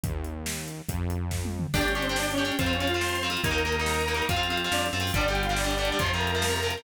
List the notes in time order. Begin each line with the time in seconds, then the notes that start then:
0.03 D#2, kick, closed hi-hat
0.24 closed hi-hat
0.46 snare
0.68 closed hi-hat
0.89 F2, kick, closed hi-hat
1.10 closed hi-hat
1.31 kick, snare
1.45 high tom
1.59 mid tom
1.74 G1 D4 G4 D5, kick, crash
1.81 D4 G4, closed hi-hat
1.88 C#4 C#5, closed hi-hat
1.95 D4 G4, closed hi-hat
2.02 C4 C5, closed hi-hat
2.09 D4 G4, closed hi-hat
2.16 D4 G4 D5, snare
2.23 closed hi-hat
2.31 C#4 C#5, closed hi-hat
2.38 D4 G4, closed hi-hat
2.45 D4 G4, closed hi-hat
2.52 closed hi-hat
2.59 F2 C4 F4 C5, kick, closed hi-hat
2.66 C4 F4, closed hi-hat
2.73 C#4 C#5, closed hi-hat
2.80 C4 F4, closed hi-hat
2.87 F4 F5, closed hi-hat
2.94 C4 F4, closed hi-hat
3.01 C4 F4 C5 C6, snare
3.09 closed hi-hat
3.15 closed hi-hat
3.23 C4 F4, closed hi-hat
3.30 C4 F4, closed hi-hat
3.37 closed hi-hat
3.44 D#2 A#3 D#4 A#4 A#5, kick, closed hi-hat
3.51 A#3 D#4, closed hi-hat
3.58 closed hi-hat
3.65 A#3 D#4, closed hi-hat
3.72 closed hi-hat
3.79 A#3 D#4, closed hi-hat
3.85 A#3 D#4 A#4 A#5, snare
3.94 closed hi-hat
4.01 closed hi-hat
4.08 A#3 D#4, closed hi-hat
4.15 A#3 D#4, closed hi-hat
4.22 closed hi-hat
4.29 F2 C4 F4 F5, kick, closed hi-hat
4.36 C4 F4, closed hi-hat
4.43 F4 F5, closed hi-hat
4.50 C4 F4, closed hi-hat
4.57 closed hi-hat
4.64 C4 F4, closed hi-hat
4.72 F2 C4 D4 F4 D5, snare
4.79 closed hi-hat
4.86 closed hi-hat
4.93 F#2 C4 F4, closed hi-hat
5.00 C4 F4, closed hi-hat
5.07 open hi-hat
5.13 G1 D3 G3 D4 G4 D5, kick, closed hi-hat
5.21 closed hi-hat
5.28 D3 G3 G4 G5, closed hi-hat
5.35 closed hi-hat
5.43 F4 F5, closed hi-hat
5.49 D3 G3, closed hi-hat
5.56 D4 G4 D5, snare
5.64 D3 G3, closed hi-hat
5.71 closed hi-hat
5.78 D3 G3, closed hi-hat
5.85 D4 D5, closed hi-hat
5.92 D3 G3, closed hi-hat
5.99 F2 C3 F3 C4 F4 C5 C6, kick, closed hi-hat
6.06 closed hi-hat
6.13 C3 F3 A#4 A#5, closed hi-hat
6.21 closed hi-hat
6.27 closed hi-hat
6.35 C3 F3, closed hi-hat
6.42 C4 F4, snare
6.49 C3 F3, closed hi-hat
6.56 A#4 A#5, closed hi-hat
6.63 C3 F3, closed hi-hat
6.71 closed hi-hat
6.77 C3 F3, closed hi-hat